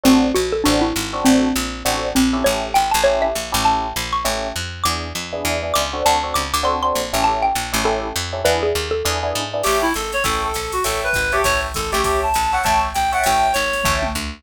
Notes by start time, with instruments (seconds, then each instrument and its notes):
0.04 electric bass (finger) A1, electric piano 1 C4 D4 F#4 A4, xylophone C4
0.35 electric bass (finger) A#1, xylophone F#4
0.52 xylophone A4
0.64 electric bass (finger) A1, electric piano 1 C4 D4 F#4 A4, xylophone D4
0.81 xylophone E4
0.96 electric bass (finger) G#1
1.13 electric piano 1 C4 D4 F#4 A4
1.25 electric bass (finger) A1, xylophone C4
1.56 electric bass (finger) A#1
1.85 electric bass (finger) A1, electric piano 1 C4 D4 F#4 A4
2.15 electric bass (finger) A#1, xylophone C4
2.33 electric piano 1 C#4 E4 G4 A4
2.44 electric bass (finger) A1, xylophone C#5
2.74 electric bass (finger) G#1, xylophone G5
2.91 electric bass (finger) A1, xylophone A5
3.04 electric piano 1 C#4 E4 G4 A4, xylophone C#5
3.22 xylophone E5
3.35 electric bass (finger) A#1
3.52 electric bass (finger) A1, electric piano 1 C#4 E4 G4 A4
3.65 xylophone A5
3.96 electric bass (finger) A#1
4.13 xylophone C#6
4.25 electric bass (finger) A1, electric piano 1 C#4 E4 G4 A4
4.56 electric bass (finger) F2
4.84 electric bass (finger) E2, electric piano 1 B3 D4 E4 G#4, xylophone D6
5.15 electric bass (finger) F2
5.33 electric piano 1 B3 D4 E4 G#4
5.45 electric bass (finger) E2
5.63 electric piano 1 B3 D4 E4 G#4
5.74 electric bass (finger) C#2, xylophone D6
5.93 electric piano 1 C4 D4 F#4 A4
6.06 electric bass (finger) D2, xylophone A5
6.23 electric piano 1 C4 D4 F#4 A4
6.34 electric bass (finger) C#2, xylophone D6
6.54 electric bass (finger) D2, xylophone D6
6.63 electric piano 1 C4 D4 F#4 A4, xylophone C6
6.83 electric piano 1 C4 D4 F#4 A4, xylophone C6
6.95 electric bass (finger) A#1
7.13 electric bass (finger) A1, electric piano 1 C#4 E4 G4 A4
7.24 xylophone A5
7.42 xylophone G5
7.55 electric bass (finger) A#1
7.73 electric bass (finger) A1, electric piano 1 C#4 E4 G4 A4
7.84 electric piano 1 C#4 E4 G4 A4, xylophone A4
8.16 electric bass (finger) F2
8.33 electric piano 1 C#4 E4 G4 A4
8.44 electric bass (finger) E2, electric piano 1 B3 D4 E4 G#4, xylophone B4
8.63 xylophone G#4
8.75 electric bass (finger) D#2
8.91 xylophone A4
9.05 electric bass (finger) E2, electric piano 1 B3 D4 E4 G#4
9.23 electric piano 1 B3 D4 E4 G#4
9.35 electric bass (finger) G#2
9.53 electric piano 1 B3 D4 E4 G#4
9.63 electric bass (finger) A1, clarinet G4, electric piano 1 C#5 E5 G5 A5, crash, ride
9.82 clarinet E4
9.94 electric bass (finger) G#1, clarinet A4, hi-hat pedal, ride
10.12 clarinet C#5, snare, ride
10.24 electric bass (finger) A1, clarinet A4, electric piano 1 C#5 E5 G5 A5, kick, ride
10.44 clarinet A4
10.54 electric bass (finger) A#1, hi-hat pedal, ride
10.72 clarinet F#4, ride
10.84 electric bass (finger) A1, clarinet A4, electric piano 1 C#5 E5 G5 A5, ride
11.04 clarinet B4
11.13 electric bass (finger) G#1, kick, hi-hat pedal, ride
11.32 clarinet G4, electric piano 1 C#5 E5 G5 A5, snare, ride
11.44 electric bass (finger) A1, clarinet C#5, kick, ride
11.74 electric bass (finger) G#1, clarinet A4, kick, hi-hat pedal, ride
11.92 electric bass (finger) A1, clarinet G4, electric piano 1 C#5 E5 G5 A5, ride
12.04 clarinet G4, electric piano 1 C#5 E5 G5 A5, kick, ride
12.23 clarinet A5
12.34 electric bass (finger) A#1, hi-hat pedal, ride
12.52 electric piano 1 C#5 E5 G5 A5, clarinet F#5, snare
12.64 electric bass (finger) A1, electric piano 1 C#5 E5 G5 A5, clarinet A5, kick, ride
12.94 electric bass (finger) A#1, clarinet G5, hi-hat pedal, ride
13.12 electric piano 1 C#5 E5 G5 A5, clarinet F#5, ride
13.23 electric bass (finger) A1, clarinet G5, ride
13.53 electric bass (finger) G#1, clarinet C#5, hi-hat pedal, ride
13.73 snare, ride
13.84 electric bass (finger) A1, electric piano 1 C#5 E5 G5 A5, kick, floor tom
14.02 mid tom
14.15 electric bass (finger) D2